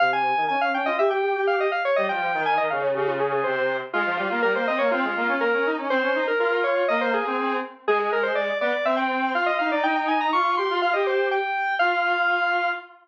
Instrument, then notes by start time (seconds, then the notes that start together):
lead 1 (square)
0.00 C3 F5
0.13 G#5
0.37 D#3
0.49 C#4 G#5
0.61 F5
0.74 C#4 G5
0.86 F4 D#5
0.99 G4 E5
1.11 G4 G5
1.23 G4
1.35 G4
1.47 F5
1.60 D#5
1.72 F5
1.85 C#5
1.96 G3 D#5
2.09 F3 G5
2.34 D#3
2.46 G#5
2.58 D#3 D#5
2.70 C#3 F5
2.82 C#5
2.95 C#3 G4
3.07 F4
3.20 G#4
3.32 G#4
3.44 C3 C5
3.93 G#3 F4
4.06 F3
4.17 G3 F4
4.30 A#3 F4
4.42 G3 A#4
4.55 A#3 C5
4.67 C4 D#5
4.79 A#3 C#5
4.91 C4 F4
5.04 G#3
5.16 A#3
5.28 C#4
5.41 A#3 A#4
5.53 C#4
5.66 D#4
5.78 C#4
5.90 C4 C5
6.02 C#4
6.15 D#4
6.27 A#4
6.39 F4 A#4
6.52 A#4
6.64 C#5
6.88 A#3 D#5
7.01 C5
7.14 G#4
7.25 C4 G#4
7.38 C4
7.87 G#3 G#4
7.99 G#4
8.13 A#4
8.23 C5
8.35 D5
8.61 B3 D5
8.85 C4 E5
8.97 G5
9.34 F4 F5
9.46 D#5
9.59 D#4 F5
9.71 D#4 D5
9.83 D#4 G5
9.96 G5
10.08 G#5
10.21 A#5
10.33 F4 C#6
10.57 G4 C6
10.70 F4
10.82 F4 F5
10.93 G4 D#5
11.07 C5
11.31 G5
11.79 F4 F5